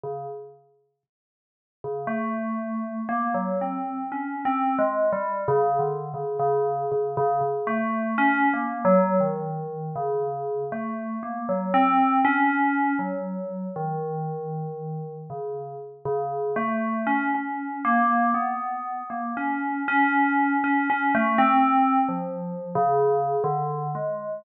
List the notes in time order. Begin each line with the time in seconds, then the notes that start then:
0.03 C#3
1.84 C#3
2.07 A3
3.09 A#3
3.34 F#3
3.61 C4
4.12 C#4
4.45 C4
4.79 G#3
5.12 G3
5.48 C#3
5.79 D3
6.14 C#3
6.39 C#3
6.92 C#3
7.17 C#3
7.41 C#3
7.67 A3
8.18 C#4
8.54 A#3
8.85 F#3
9.20 D#3
9.96 C#3
10.72 A3
11.23 A#3
11.49 F#3
11.74 C4
12.25 C#4
12.99 F#3
13.76 D#3
15.30 C#3
16.05 C#3
16.56 A3
17.07 C#4
17.35 C#4
17.85 A#3
18.34 B3
19.10 A#3
19.37 C#4
19.88 C#4
20.64 C#4
20.90 C#4
21.15 A3
21.38 C4
22.08 F3
22.75 C#3
23.44 D3
23.95 G#3